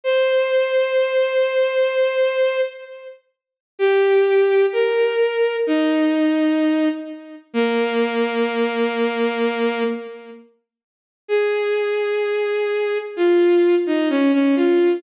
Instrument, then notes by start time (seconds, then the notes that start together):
violin
0.04 C5
3.79 G4
4.73 A#4
5.67 D#4
7.54 A#3
11.28 G#4
13.17 F4
13.87 D#4
14.10 C#4
14.33 C#4
14.56 F4